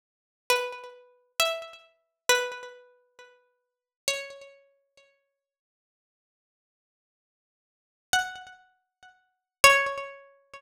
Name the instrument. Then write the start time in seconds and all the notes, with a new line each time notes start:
pizzicato strings
0.50 B4
1.40 E5
2.29 B4
4.08 C#5
8.13 F#5
9.64 C#5